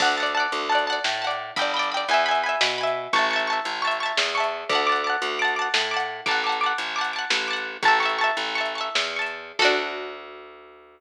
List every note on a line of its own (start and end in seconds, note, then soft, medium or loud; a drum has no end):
0.00 0.47 D2 loud
0.00 0.16 F#5 medium
0.00 0.16 A5 medium
0.00 kick loud
0.00 crash loud
0.05 0.16 D5 medium
0.17 0.33 F#5 medium
0.17 0.33 A5 medium
0.23 0.33 D5 medium
0.23 closed hi-hat medium
0.35 0.67 F#5 medium
0.35 0.67 A5 medium
0.40 0.67 D5 medium
0.52 0.99 D2 loud
0.52 closed hi-hat loud
0.69 0.86 F#5 medium
0.69 0.86 A5 medium
0.75 0.86 D5 medium
0.75 closed hi-hat medium
0.87 1.19 F#5 medium
0.87 1.19 A5 medium
0.92 1.19 D5 medium
1.04 1.51 A2 medium
1.04 snare loud
1.22 1.54 F#5 medium
1.22 1.54 A5 medium
1.27 1.54 D5 medium
1.27 closed hi-hat medium
1.56 2.05 G1 loud
1.56 1.72 G5 medium
1.56 1.72 B5 medium
1.56 kick loud
1.56 closed hi-hat loud
1.62 1.72 D5 medium
1.74 1.90 G5 medium
1.74 1.90 B5 medium
1.79 1.90 D5 medium
1.79 closed hi-hat medium
1.92 2.08 G5 medium
1.92 2.08 B5 medium
1.97 2.08 D5 medium
2.08 2.56 E2 loud
2.08 2.24 G#5 medium
2.08 2.24 B5 medium
2.08 closed hi-hat loud
2.14 2.24 E5 medium
2.26 2.42 G#5 medium
2.26 2.42 B5 medium
2.31 2.42 E5 medium
2.31 closed hi-hat medium
2.43 2.76 G#5 medium
2.43 2.76 B5 medium
2.49 2.76 E5 medium
2.61 3.08 B2 loud
2.61 snare loud
2.78 3.10 G#5 medium
2.78 3.10 B5 medium
2.83 3.10 E5 medium
2.83 closed hi-hat medium
3.13 3.60 A1 loud
3.13 3.29 A5 medium
3.13 3.29 C#6 medium
3.13 kick loud
3.13 closed hi-hat loud
3.19 3.29 E5 medium
3.31 3.47 A5 medium
3.31 3.47 C#6 medium
3.36 3.47 E5 medium
3.36 closed hi-hat medium
3.47 3.79 A5 medium
3.47 3.79 C#6 medium
3.53 3.79 E5 medium
3.65 4.12 A1 medium
3.65 closed hi-hat loud
3.82 3.98 A5 medium
3.82 3.98 C#6 medium
3.87 3.98 E5 medium
3.87 closed hi-hat loud
4.00 4.32 A5 medium
4.00 4.32 C#6 medium
4.06 4.32 E5 medium
4.17 4.64 E2 loud
4.17 snare loud
4.35 4.67 A5 medium
4.35 4.67 C#6 medium
4.40 4.67 E5 medium
4.40 closed hi-hat medium
4.69 5.16 D2 loud
4.69 4.86 A5 medium
4.69 4.86 D6 medium
4.69 kick loud
4.69 closed hi-hat loud
4.75 4.86 F#5 medium
4.87 5.03 A5 medium
4.87 5.03 D6 medium
4.92 5.03 F#5 medium
4.92 closed hi-hat medium
5.04 5.36 A5 medium
5.04 5.36 D6 medium
5.10 5.36 F#5 medium
5.22 5.69 D2 loud
5.22 closed hi-hat loud
5.39 5.55 A5 medium
5.39 5.55 D6 medium
5.45 5.55 F#5 medium
5.45 closed hi-hat medium
5.56 5.88 A5 medium
5.56 5.88 D6 medium
5.62 5.88 F#5 medium
5.74 6.21 A2 loud
5.74 snare loud
5.91 6.23 A5 medium
5.91 6.23 D6 medium
5.97 6.23 F#5 medium
5.97 closed hi-hat medium
6.26 6.73 A1 loud
6.26 6.42 A5 medium
6.26 6.42 D6 medium
6.26 kick loud
6.26 closed hi-hat loud
6.31 6.42 F#5 medium
6.44 6.60 A5 medium
6.44 6.60 D6 medium
6.49 6.60 F#5 medium
6.49 closed hi-hat medium
6.61 6.93 A5 medium
6.61 6.93 D6 medium
6.66 6.93 F#5 medium
6.78 7.25 A1 medium
6.78 closed hi-hat loud
6.96 7.12 A5 medium
6.96 7.12 D6 medium
7.01 7.12 F#5 medium
7.01 closed hi-hat medium
7.13 7.45 A5 medium
7.13 7.45 D6 medium
7.19 7.45 F#5 medium
7.30 7.77 A1 medium
7.30 snare loud
7.48 7.80 A5 medium
7.48 7.80 D6 medium
7.53 7.80 F#5 medium
7.53 closed hi-hat medium
7.83 8.31 A1 loud
7.83 7.99 A5 medium
7.83 7.99 C#6 medium
7.83 kick loud
7.83 closed hi-hat loud
7.88 7.99 E5 medium
8.00 8.17 A5 medium
8.00 8.17 C#6 medium
8.05 8.17 E5 medium
8.05 closed hi-hat medium
8.18 8.53 A5 medium
8.18 8.53 C#6 medium
8.24 8.53 E5 medium
8.37 8.89 A1 loud
8.37 closed hi-hat loud
8.55 8.73 A5 medium
8.55 8.73 C#6 medium
8.61 8.73 E5 medium
8.65 closed hi-hat medium
8.75 9.13 A5 medium
8.75 9.13 C#6 medium
8.81 9.13 E5 medium
8.95 9.52 E2 loud
8.95 snare loud
9.16 9.56 A5 medium
9.16 9.56 C#6 medium
9.22 9.56 E5 medium
9.26 closed hi-hat medium
9.59 11.00 D2 loud
9.59 11.00 F#4 loud
9.59 11.00 A4 loud
9.59 kick loud
9.59 crash loud
9.65 11.00 D4 loud